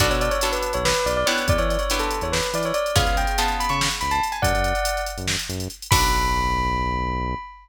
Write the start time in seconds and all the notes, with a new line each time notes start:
0.00 B1 B3 D4 F#4 A4 D5, kick, closed hi-hat
0.10 B2 C#5, closed hi-hat
0.21 D5, closed hi-hat
0.31 C#5, closed hi-hat
0.41 B3 D4 F#4 A4, closed hi-hat
0.52 B4, closed hi-hat
0.62 closed hi-hat
0.73 B1 C#5, closed hi-hat
0.85 B4, snare
0.94 closed hi-hat
1.06 B1 D5, closed hi-hat
1.17 D5
1.26 B3 D4 E4 G4 C#5, closed hi-hat
1.38 closed hi-hat
1.48 E2 D5, kick, closed hi-hat
1.58 E3 C#5, closed hi-hat
1.70 D5, closed hi-hat
1.79 C#5, closed hi-hat
1.90 B3 D4 E4 G4, closed hi-hat
1.99 A4, closed hi-hat
2.11 closed hi-hat
2.21 E2 C#5, closed hi-hat
2.32 B4, snare
2.43 closed hi-hat
2.53 E3 D5, closed hi-hat
2.63 C#5, closed hi-hat
2.74 D5, closed hi-hat
2.86 closed hi-hat
2.96 C#2 B3 C#4 F4 G#4 F5, kick, closed hi-hat
3.06 C#2, closed hi-hat
3.17 G5, closed hi-hat
3.27 closed hi-hat
3.38 B3 C#4 F4 G#4 A5, closed hi-hat
3.48 closed hi-hat
3.60 B5, closed hi-hat
3.69 C#3 C#6, closed hi-hat
3.81 snare
3.91 closed hi-hat
4.01 C#2 B5, closed hi-hat
4.11 A5, closed hi-hat
4.23 closed hi-hat
4.32 G#5, closed hi-hat
4.42 F#2 D5 F#5, kick, closed hi-hat
4.54 F#2, closed hi-hat
4.64 closed hi-hat
4.75 closed hi-hat
4.85 closed hi-hat
4.97 closed hi-hat
5.06 closed hi-hat
5.18 F#2, closed hi-hat
5.28 snare
5.39 closed hi-hat
5.49 F#2, closed hi-hat
5.60 closed hi-hat
5.70 closed hi-hat
5.82 closed hi-hat
5.91 B1 B3 D4 F#4 A4 B5, kick, crash